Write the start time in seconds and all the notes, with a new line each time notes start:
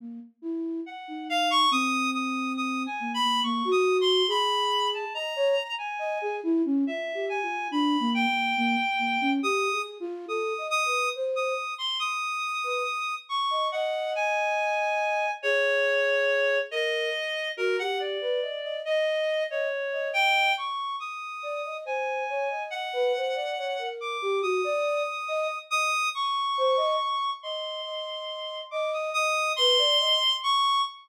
0.00 A#3
0.42 E4
0.86 F#5
1.08 D#4
1.30 F5
1.51 C#6
1.71 C4 D#6
2.14 D#6
2.57 D#6
2.86 G#5
3.00 A#3
3.14 B5
3.22 A#3
3.43 A#3 C#6
3.65 F#4
3.71 D#6
4.01 C6
4.28 G#4 B5
4.94 A5
5.14 D#5 A#5
5.36 C#5
5.78 G#5
5.99 D#5
6.21 G#4
6.43 E4
6.65 C#4
6.87 F4 E5
7.14 G4
7.29 G#5
7.42 F4
7.71 D4 B5
8.00 A#3
8.14 G5
8.29 A#3
8.57 A#3
8.99 A#3
9.21 C#4
9.43 G4 D#6
9.72 G#4
10.00 F4
10.28 A4 D#6
10.58 D#5
10.70 D#6
10.85 B4
11.15 C5
11.36 D#6
11.78 C6
11.99 D#6
12.64 B4
13.29 C#6
13.51 D#5
13.72 D#5 F#5
14.15 G#5
15.43 G#4 C#5
16.71 A#4 D#5
17.57 F#4 A#4
17.79 G4 F#5
18.00 D5
18.21 B4
18.42 D#5
18.63 D#5
18.85 D#5
19.49 C#5 D#5
19.92 D#5
20.13 G5
20.57 C#6
21.00 D#6
21.43 D5
21.65 D#5
21.85 C5 G#5
22.29 C#5
22.50 D#5
22.70 F#5
22.93 B4
23.16 C5
23.35 D5
23.58 C#5
23.79 A#4
24.01 D6
24.22 G4
24.42 F#4 D#6
24.64 D5
25.28 D#5
25.71 D#5 D#6
26.14 C#6
26.58 C5
26.77 D#5
27.43 D#5 C6
27.84 D#5
28.71 D#5 D6
28.93 D#6
29.14 D#5 D#6
29.56 B4 C6
29.78 D5
30.00 D#5
30.43 C#6